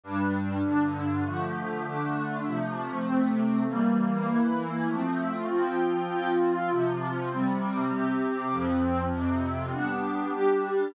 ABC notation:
X:1
M:4/4
L:1/8
Q:1/4=99
K:F
V:1 name="Pad 2 (warm)"
[G,,G,D]2 [G,,D,D]2 | [D,F,A,]2 [D,A,D]2 [C,F,A,]2 [C,A,C]2 | [E,G,B,]2 [E,B,E]2 [F,A,C]2 [F,CF]2 | [K:Fm] [F,CF]2 [C,F,F]2 [C,G,C]2 [C,CG]2 |
[F,,F,C]2 [F,,C,C]2 [G,=B,=D]2 [G,DG]2 |]